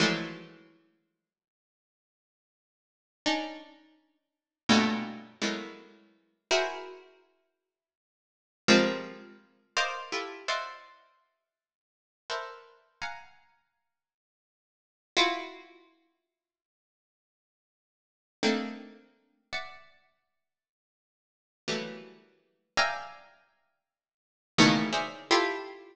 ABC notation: X:1
M:9/8
L:1/8
Q:3/8=55
K:none
V:1 name="Harpsichord"
[E,F,_G,_A,=A,]6 z3 | [_D=D_E]3 z [G,,A,,_B,,=B,,]2 [=E,_G,_A,=A,_B,=B,]3 | [E_G_A_Bc]6 [F,=G,_A,_B,C]3 | [_Bcd_ef] [=EFGA] [cd_e=ef_g]2 z3 [AB=Bcde]2 |
[f_g_a_b]6 [EF_G]3 | z6 [A,_B,CD_E]3 | [de_g]5 z [E,_G,=G,A,_B,=B,]3 | [defg_a_b]5 [=A,,_B,,=B,,_D,_E,=E,] [_A_Bc_d=de] [EFG=A]2 |]